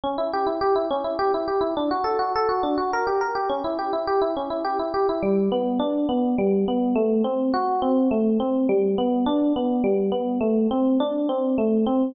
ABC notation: X:1
M:3/4
L:1/16
Q:1/4=104
K:D
V:1 name="Electric Piano 1"
C E G E G E C E G E G E | D F A F A F D F _B G B G | C E G E G E C E G E G E | [K:G] G,2 B,2 D2 B,2 G,2 B,2 |
A,2 C2 F2 C2 A,2 C2 | G,2 B,2 D2 B,2 G,2 B,2 | A,2 C2 D2 C2 A,2 C2 |]